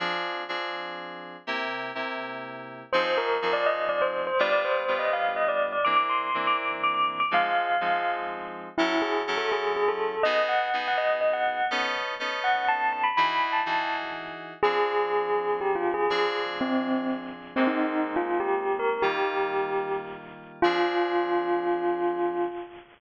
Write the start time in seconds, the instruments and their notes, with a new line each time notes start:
0.00 electric piano 2 F3 C4 D4 G#4
0.49 electric piano 2 F3 C4 D4 G#4
1.47 electric piano 2 C3 A#3 E4 G4
1.95 electric piano 2 C3 A#3 E4 G4
2.93 electric piano 2 F3 C4 D#4 G#4, tubular bells C5
3.05 tubular bells C5
3.17 tubular bells A#4
3.42 electric piano 2 F3 C4 D#4 G#4
3.53 tubular bells D5
3.66 tubular bells D#5
3.89 tubular bells D5
4.02 tubular bells C5
4.27 tubular bells C5
4.39 electric piano 2 G3 B3 D4 F4, tubular bells D5
4.52 tubular bells D5
4.65 tubular bells C5
4.88 electric piano 2 G3 B3 D4 F4
4.99 tubular bells D#5
5.13 tubular bells F5
5.36 tubular bells D#5
5.48 tubular bells D5
5.72 tubular bells D5
5.85 electric piano 2 E3 A#3 C4 D4, tubular bells D6
5.96 tubular bells D6
6.09 tubular bells C6
6.34 electric piano 2 E3 A#3 C4 D4
6.47 tubular bells D6
6.58 tubular bells D6
6.83 tubular bells D6
6.94 tubular bells D6
7.20 tubular bells D6
7.31 electric piano 2 F3 G#3 C4 D#4, tubular bells F5
7.81 electric piano 2 F3 G#3 C4 D#4
8.78 electric piano 2 F#3 C#4 E4 A4, tubular bells E4
9.02 tubular bells G#4
9.27 electric piano 2 F#3 C#4 E4 A4
9.38 tubular bells A4
9.52 tubular bells G#4
9.76 tubular bells G#4
9.88 tubular bells A4
10.23 electric piano 2 B3 D#4 F#4 G#4, tubular bells D#5
10.49 tubular bells F#5
10.73 electric piano 2 B3 D#4 F#4 G#4
10.88 tubular bells F#5
10.98 tubular bells D#5
11.21 tubular bells D#5
11.33 tubular bells F#5
11.71 electric piano 2 B3 C#4 D#4 A4
12.20 electric piano 2 B3 C#4 D#4 A4
12.44 tubular bells F#5
12.68 tubular bells A5
12.93 tubular bells A5
13.04 tubular bells B5
13.17 electric piano 2 E3 D#4 F#4 G#4, tubular bells B5
13.52 tubular bells A5
13.66 electric piano 2 E3 D#4 F#4 G#4
14.63 electric piano 2 F3 C4 D4 G#4, tubular bells G#4
15.61 tubular bells G4
15.75 tubular bells F4
15.94 tubular bells G#4
16.10 electric piano 2 F3 C4 D4 G#4, tubular bells G#4
16.61 tubular bells C4
17.56 electric piano 2 G#3 A#3 C4 D#4, tubular bells C4
17.67 tubular bells D#4
18.16 tubular bells F4
18.40 tubular bells G4
18.79 tubular bells A#4
19.02 electric piano 2 D#3 G3 A#3 F4, tubular bells G4
20.62 electric piano 2 F3 C4 D4 G#4, tubular bells F4